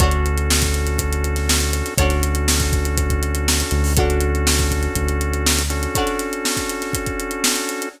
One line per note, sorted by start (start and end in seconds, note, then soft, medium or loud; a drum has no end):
0.00 1.83 D2 loud
0.00 1.94 C#4 medium
0.00 1.94 D4 medium
0.00 1.94 F#4 loud
0.00 1.94 F#4 medium
0.00 1.94 A4 loud
0.00 1.94 A4 medium
0.00 1.94 C#5 medium
0.00 kick loud
0.00 closed hi-hat loud
0.11 closed hi-hat medium
0.26 closed hi-hat medium
0.38 closed hi-hat medium
0.50 snare loud
0.61 kick medium
0.61 snare medium
0.61 closed hi-hat medium
0.74 closed hi-hat medium
0.87 closed hi-hat medium
0.98 kick loud
0.98 closed hi-hat loud
1.13 closed hi-hat medium
1.24 closed hi-hat medium
1.36 snare medium
1.36 closed hi-hat medium
1.49 snare loud
1.60 closed hi-hat medium
1.73 closed hi-hat loud
1.86 snare soft
1.86 closed hi-hat medium
1.98 3.63 D2 loud
1.98 3.93 C#4 medium
1.98 3.93 D4 medium
1.98 3.93 F#4 loud
1.98 3.93 F#4 medium
1.98 3.93 A4 medium
1.98 3.93 C#5 medium
1.98 kick loud
1.98 closed hi-hat loud
2.02 3.93 D4 medium
2.10 snare soft
2.10 closed hi-hat medium
2.23 closed hi-hat loud
2.35 closed hi-hat medium
2.48 snare loud
2.60 kick medium
2.60 snare medium
2.60 closed hi-hat medium
2.73 kick loud
2.73 closed hi-hat medium
2.85 closed hi-hat medium
2.98 kick medium
2.98 closed hi-hat loud
3.10 kick loud
3.10 closed hi-hat medium
3.23 closed hi-hat medium
3.35 closed hi-hat medium
3.48 snare loud
3.60 closed hi-hat medium
3.71 4.88 D2 loud
3.71 closed hi-hat medium
3.84 open hi-hat medium
3.96 5.63 C#4 loud
3.96 5.63 D4 loud
3.96 5.91 D4 medium
3.96 5.63 F#4 loud
3.96 5.91 F#4 medium
3.96 5.91 A4 medium
3.96 5.63 A4 loud
3.96 5.91 C#5 medium
3.96 kick loud
3.96 closed hi-hat loud
4.10 closed hi-hat medium
4.21 closed hi-hat medium
4.35 closed hi-hat medium
4.47 snare loud
4.58 kick medium
4.58 snare medium
4.58 closed hi-hat medium
4.71 kick medium
4.71 closed hi-hat medium
4.83 closed hi-hat medium
4.95 5.87 D2 medium
4.95 kick medium
4.95 closed hi-hat loud
5.08 closed hi-hat medium
5.21 closed hi-hat medium
5.33 closed hi-hat medium
5.46 snare loud
5.59 closed hi-hat medium
5.70 7.89 C#4 loud
5.70 7.89 D4 loud
5.70 7.89 F#4 loud
5.70 7.89 A4 loud
5.70 closed hi-hat medium
5.83 closed hi-hat medium
5.95 7.90 D4 medium
5.95 7.90 F#4 medium
5.95 7.90 A4 medium
5.95 7.90 C#5 medium
5.95 kick loud
5.95 closed hi-hat loud
6.07 snare soft
6.07 closed hi-hat medium
6.19 snare soft
6.19 closed hi-hat medium
6.33 closed hi-hat medium
6.45 snare loud
6.57 kick medium
6.57 snare medium
6.57 closed hi-hat medium
6.69 closed hi-hat medium
6.82 snare medium
6.82 closed hi-hat medium
6.93 kick medium
6.93 closed hi-hat loud
7.06 kick medium
7.06 closed hi-hat medium
7.20 closed hi-hat medium
7.31 closed hi-hat medium
7.44 snare loud
7.56 closed hi-hat medium
7.69 snare soft
7.69 closed hi-hat medium
7.82 closed hi-hat medium